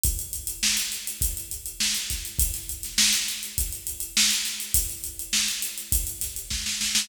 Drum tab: HH |xxxx-xxxxxxx-xxx|xxxx-xxxxxxx-xxx|xxxx-xxxxxxx----|
SD |----o-------o-o-|-o-oo-o-----o-o-|----o-----o-oooo|
BD |o-------o-----o-|o-------o-------|o-------o---o---|